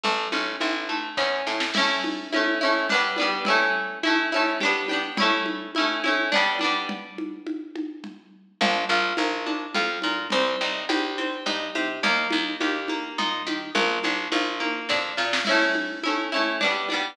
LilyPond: <<
  \new Staff \with { instrumentName = "Pizzicato Strings" } { \time 3/4 \key a \mixolydian \tempo 4 = 105 a8 cis'8 e'8 a8 cis'8 e'8 | <a cis' e'>4 <a cis' e'>8 <a cis' e'>8 <g b d'>8 <g b d'>8 | <a cis' e'>4 <a cis' e'>8 <a cis' e'>8 <b d' g'>8 <b d' g'>8 | <a cis' e'>4 <a cis' e'>8 <a cis' e'>8 <g b d'>8 <g b d'>8 |
r2. | \key bes \mixolydian d'8 f'8 bes'8 d'8 f'8 bes'8 | c'8 ees'8 g'8 c'8 ees'8 g'8 | bes8 ees'8 g'8 bes8 ees'8 g'8 |
bes8 d'8 f'8 bes8 d'8 f'8 | \key a \mixolydian <a cis' e'>4 <a cis' e'>8 <a cis' e'>8 <g b d'>8 <g b d'>8 | }
  \new Staff \with { instrumentName = "Electric Bass (finger)" } { \clef bass \time 3/4 \key a \mixolydian a,,8 a,,8 a,,4 e,8 a,8 | r2. | r2. | r2. |
r2. | \key bes \mixolydian bes,,8 bes,,8 bes,,4 f,8 bes,8 | c,8 c,8 c,4 g,8 c8 | ees,8 ees,8 ees,4 bes,8 ees8 |
bes,,8 bes,,8 bes,,4 f,8 bes,8 | \key a \mixolydian r2. | }
  \new DrumStaff \with { instrumentName = "Drums" } \drummode { \time 3/4 cgl8 cgho8 cgho8 cgho8 <bd sn>8 sn16 sn16 | <cgl cymc>8 cgho8 cgho4 cgl8 cgho8 | cgl4 cgho8 cgho8 cgl8 cgho8 | cgl8 cgho8 cgho8 cgho8 cgl8 cgho8 |
cgl8 cgho8 cgho8 cgho8 cgl4 | cgl4 cgho8 cgho8 cgl8 cgho8 | cgl4 cgho8 cgho8 cgl8 cgho8 | cgl8 cgho8 cgho8 cgho8 cgl8 cgho8 |
cgl8 cgho8 cgho8 cgho8 <bd sn>8 sn16 sn16 | <cgl cymc>8 cgho8 cgho4 cgl8 cgho8 | }
>>